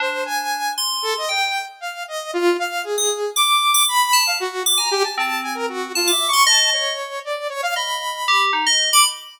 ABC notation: X:1
M:5/8
L:1/16
Q:1/4=116
K:none
V:1 name="Electric Piano 2"
D6 c'4 | g2 z8 | z3 ^d' z2 =d'3 d' | z2 a2 z2 d' ^g3 |
C6 a d'2 c' | ^d4 z6 | ^d4 G2 ^D d2 b |]
V:2 name="Lead 2 (sawtooth)"
c2 ^g4 z2 A ^d | g3 z f2 ^d2 F2 | f2 ^G4 d'4 | b3 f ^F2 z ^a G =a |
a2 ^g ^A ^F2 (3=F2 e2 ^c'2 | a2 ^c4 d2 c f | b6 z3 d' |]